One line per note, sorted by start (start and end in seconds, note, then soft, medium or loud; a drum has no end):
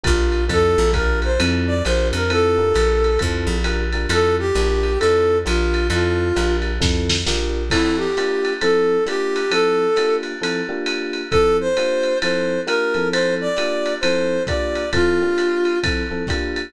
0.03 0.49 A#1 loud
0.03 0.38 D4 medium
0.03 0.38 F4 medium
0.03 0.44 F4 medium
0.03 0.38 G4 medium
0.03 0.38 A#4 medium
0.03 kick medium
0.03 hi-hat pedal medium
0.03 ride medium
0.32 ride medium
0.48 0.76 F2 medium
0.48 0.83 C4 loud
0.48 0.83 E4 medium
0.48 0.83 F4 medium
0.48 0.83 A4 loud
0.48 0.91 A4 medium
0.48 kick medium
0.48 ride medium
0.78 1.38 A#1 loud
0.93 1.29 D4 loud
0.93 1.29 F4 loud
0.93 1.29 G4 medium
0.93 1.19 A#4 medium
0.93 1.29 A#4 loud
0.93 kick medium
0.93 hi-hat pedal medium
0.93 ride medium
1.22 1.40 C5 medium
1.22 ride medium
1.39 1.82 F2 loud
1.39 1.74 C4 loud
1.39 1.74 E4 medium
1.39 1.74 F4 medium
1.39 1.74 A4 medium
1.39 ride loud
1.67 1.83 D5 medium
1.85 2.12 A#1 loud
1.85 2.20 D4 loud
1.85 2.20 F4 medium
1.85 2.20 G4 loud
1.85 2.20 A#4 loud
1.85 2.08 C5 medium
1.85 hi-hat pedal medium
1.85 ride medium
2.13 2.73 F2 loud
2.13 2.31 A#4 medium
2.13 ride medium
2.30 2.56 C4 loud
2.30 2.56 E4 loud
2.30 2.56 F4 medium
2.30 2.56 A4 loud
2.30 3.19 A4 medium
2.30 ride medium
2.57 3.10 D4 medium
2.57 3.10 F4 medium
2.57 3.10 G4 medium
2.57 3.10 A#4 medium
2.74 3.18 A#1 loud
2.74 hi-hat pedal medium
2.74 ride medium
3.04 ride medium
3.19 3.48 F2 loud
3.19 3.55 C4 medium
3.19 3.55 E4 medium
3.19 3.55 F4 medium
3.19 3.55 A4 medium
3.19 kick medium
3.19 ride medium
3.47 4.06 A#1 loud
3.64 3.84 D4 medium
3.64 3.84 F4 medium
3.64 3.84 G4 loud
3.64 3.84 A#4 loud
3.64 hi-hat pedal medium
3.64 ride medium
3.92 4.06 D4 medium
3.92 4.06 F4 medium
3.92 4.06 G4 medium
3.92 4.06 A#4 medium
3.92 ride medium
4.09 4.52 F2 loud
4.09 4.44 C4 medium
4.09 4.44 E4 loud
4.09 4.44 F4 loud
4.09 4.44 A4 medium
4.09 4.35 A4 medium
4.09 ride loud
4.39 4.99 G4 medium
4.55 4.98 A#1 loud
4.55 4.90 D4 loud
4.55 4.90 F4 medium
4.55 4.90 G4 medium
4.55 4.90 A#4 medium
4.55 hi-hat pedal medium
4.55 ride medium
4.83 ride medium
4.99 5.45 F2 medium
4.99 5.35 C4 medium
4.99 5.35 E4 medium
4.99 5.35 F4 medium
4.99 5.38 A4 medium
4.99 5.35 A4 loud
4.99 ride medium
5.45 5.89 A#1 loud
5.45 5.80 D4 loud
5.45 5.80 F4 loud
5.45 5.87 F4 medium
5.45 5.80 G4 loud
5.45 5.80 A#4 medium
5.45 hi-hat pedal medium
5.45 ride medium
5.74 ride medium
5.90 6.32 F2 loud
5.90 6.25 C4 medium
5.90 6.25 E4 medium
5.90 6.25 F4 loud
5.90 6.56 F4 medium
5.90 6.25 A4 medium
5.90 ride medium
6.36 6.79 A#1 medium
6.36 6.70 D4 medium
6.36 6.70 F4 medium
6.36 6.70 G4 medium
6.36 6.70 A#4 medium
6.36 hi-hat pedal medium
6.36 ride medium
6.62 ride medium
6.80 7.24 F2 medium
6.80 7.15 C4 medium
6.80 7.15 E4 medium
6.80 7.15 F4 medium
6.80 7.15 A4 loud
6.80 kick medium
6.80 snare medium
7.09 snare medium
7.26 7.70 A#1 medium
7.26 7.61 D4 medium
7.26 7.61 F4 loud
7.26 7.61 G4 medium
7.26 7.61 A#4 loud
7.26 snare medium
7.70 8.06 F3 loud
7.70 8.06 C4 loud
7.70 7.96 E4 medium
7.70 8.06 E4 loud
7.70 8.06 A4 loud
7.70 kick medium
7.70 crash medium
7.70 ride medium
7.97 8.53 G4 medium
8.17 8.52 A#3 loud
8.17 8.52 D4 loud
8.17 8.52 F4 loud
8.17 8.52 G4 loud
8.17 hi-hat pedal medium
8.17 ride medium
8.45 ride medium
8.61 8.96 F3 loud
8.61 8.96 C4 loud
8.61 8.96 E4 loud
8.61 8.96 A4 loud
8.61 9.04 A4 medium
8.61 ride medium
9.06 9.41 A#3 loud
9.06 9.41 D4 loud
9.06 9.41 F4 loud
9.06 9.41 G4 loud
9.06 9.52 G4 medium
9.06 hi-hat pedal medium
9.06 ride medium
9.36 ride medium
9.51 9.86 F3 loud
9.51 9.86 C4 loud
9.51 9.86 E4 loud
9.51 9.86 A4 loud
9.51 10.16 A4 medium
9.51 ride loud
9.96 10.32 A#3 loud
9.96 10.32 D4 loud
9.96 10.32 F4 loud
9.96 10.32 G4 medium
9.96 hi-hat pedal medium
9.96 ride medium
10.23 ride medium
10.41 10.61 F3 loud
10.41 10.61 C4 medium
10.41 10.61 E4 medium
10.41 10.61 A4 loud
10.41 ride medium
10.69 11.21 A#3 loud
10.69 11.21 D4 loud
10.69 11.21 F4 loud
10.69 11.21 G4 loud
10.86 hi-hat pedal medium
10.86 ride medium
11.13 ride medium
11.31 11.67 F3 loud
11.31 11.67 C4 loud
11.31 11.67 E4 loud
11.31 11.57 A4 medium
11.31 11.67 A4 loud
11.31 kick medium
11.31 ride medium
11.61 12.18 C5 medium
11.77 12.12 A#3 loud
11.77 12.12 D4 loud
11.77 12.12 F4 loud
11.77 12.12 G4 medium
11.77 hi-hat pedal medium
11.77 ride medium
12.03 ride medium
12.22 12.57 F3 loud
12.22 12.57 C4 loud
12.22 12.57 E4 loud
12.22 12.57 A4 medium
12.22 12.60 C5 medium
12.22 ride medium
12.67 12.93 A#3 loud
12.67 12.93 D4 medium
12.67 12.93 F4 loud
12.67 12.93 G4 loud
12.67 13.08 A#4 medium
12.67 hi-hat pedal medium
12.67 ride medium
12.94 13.47 F3 loud
12.94 13.47 C4 loud
12.94 13.47 E4 medium
12.94 13.47 A4 loud
12.94 ride medium
13.12 13.34 C5 medium
13.12 ride loud
13.41 13.94 D5 medium
13.57 13.92 A#3 loud
13.57 13.92 D4 loud
13.57 13.92 F4 loud
13.57 13.92 G4 loud
13.57 hi-hat pedal medium
13.57 ride medium
13.86 ride medium
14.01 14.38 F3 loud
14.01 14.38 C4 loud
14.01 14.38 E4 loud
14.01 14.38 A4 medium
14.01 14.43 C5 medium
14.01 ride loud
14.47 14.83 A#3 loud
14.47 14.83 D4 medium
14.47 14.83 F4 loud
14.47 14.83 G4 loud
14.47 14.90 D5 medium
14.47 kick medium
14.47 hi-hat pedal medium
14.47 ride medium
14.75 ride medium
14.93 15.20 F3 loud
14.93 15.20 C4 loud
14.93 15.20 E4 loud
14.93 15.79 F4 medium
14.93 15.20 A4 loud
14.93 kick medium
14.93 ride medium
15.22 15.74 A#3 loud
15.22 15.74 D4 loud
15.22 15.74 F4 medium
15.22 15.74 G4 loud
15.38 hi-hat pedal medium
15.38 ride medium
15.65 ride medium
15.83 16.03 F3 loud
15.83 16.03 C4 loud
15.83 16.03 E4 loud
15.83 16.03 A4 medium
15.83 kick medium
15.83 ride loud
16.11 16.23 F3 medium
16.11 16.23 C4 medium
16.11 16.23 E4 medium
16.11 16.23 A4 medium
16.27 16.63 A#3 loud
16.27 16.63 D4 loud
16.27 16.63 F4 medium
16.27 16.63 G4 loud
16.27 kick medium
16.27 hi-hat pedal medium
16.27 ride medium
16.56 ride medium